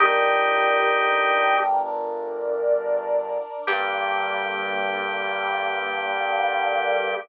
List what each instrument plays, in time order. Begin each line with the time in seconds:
0.00 synth bass 1 G1, brass section D4 G4 A#4, drawbar organ D#4 G4
1.84 brass section D4 A#4 D5
3.67 synth bass 1 G2, brass section D3 G3 A#3, drawbar organ G4